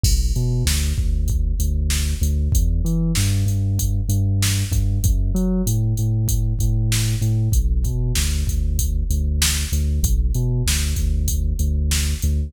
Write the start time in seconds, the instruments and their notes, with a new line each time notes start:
0.04 synth bass 2 B1, kick, crash
0.36 synth bass 2 B2, closed hi-hat
0.65 synth bass 2 D2, snare
0.98 synth bass 2 D2, kick
1.28 kick, closed hi-hat
1.59 synth bass 2 D2, closed hi-hat
1.90 snare
2.21 synth bass 2 D2, closed hi-hat
2.52 synth bass 2 E2, kick, closed hi-hat
2.85 synth bass 2 E3, closed hi-hat
3.15 synth bass 2 G2, snare
3.46 synth bass 2 G2, closed hi-hat
3.79 kick, closed hi-hat
4.09 synth bass 2 G2, closed hi-hat
4.42 snare
4.71 synth bass 2 G2, kick, closed hi-hat
5.04 synth bass 2 F#2, kick, closed hi-hat
5.35 synth bass 2 F#3, closed hi-hat
5.67 synth bass 2 A2, closed hi-hat
5.97 synth bass 2 A2, closed hi-hat
6.28 kick, closed hi-hat
6.59 synth bass 2 A2, kick, closed hi-hat
6.92 snare
7.21 synth bass 2 A2, closed hi-hat
7.52 synth bass 2 B1, kick, closed hi-hat
7.84 synth bass 2 B2, kick, closed hi-hat
8.15 synth bass 2 D2, snare
8.47 synth bass 2 D2, kick, closed hi-hat
8.79 kick, closed hi-hat
9.10 synth bass 2 D2, closed hi-hat
9.42 snare
9.72 synth bass 2 D2, closed hi-hat
10.03 synth bass 2 B1, kick, closed hi-hat
10.35 synth bass 2 B2, closed hi-hat
10.66 synth bass 2 D2, snare
10.96 synth bass 2 D2, kick, closed hi-hat
11.28 kick, closed hi-hat
11.59 synth bass 2 D2, closed hi-hat
11.91 snare
12.22 synth bass 2 D2, closed hi-hat